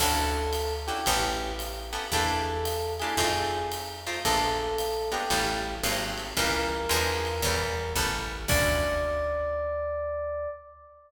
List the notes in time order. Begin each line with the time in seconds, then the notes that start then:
0.00 D2 C#4 D4 E4 F#4 A4, kick, crash, ride
0.53 hi-hat pedal, ride
0.87 C#4 D4 E4 F#4 G4, ride
1.06 A1 B3 C#4 G4 A4, kick, ride
1.59 hi-hat pedal, ride
1.93 B3 C#4 G4 A4, ride
2.12 E2 A#3 D4 E4 G4 A4, kick, ride
2.65 hi-hat pedal, ride
2.99 A#3 D4 E4 G4 G#4, ride
3.17 F2 A3 C4 D#4 F4, kick, ride
3.72 hi-hat pedal, ride
4.07 A3 C4 D#4 F4, ride
4.25 A#1 G#3 A#3 B3 D4 A4, kick, ride
4.78 hi-hat pedal, ride
5.12 G#3 A#3 B3 D4 G4, ride
5.30 A1 G3 A3 B3 C#4, kick, ride
5.83 G#1 F#3 G#3 A#3 C4, hi-hat pedal, ride
6.17 ride
6.37 C#2 E3 G3 A#3 C#4 A#4, kick, ride
6.89 E2 E3 F3 G#3 D4, hi-hat pedal, ride
7.25 ride
7.42 E2 E3 G3 B3 C#4, kick, ride
7.96 A1 G3 A3 B3 C#4, kick
8.48 D2 C#4 D4 E4 F#4 D5, kick, crash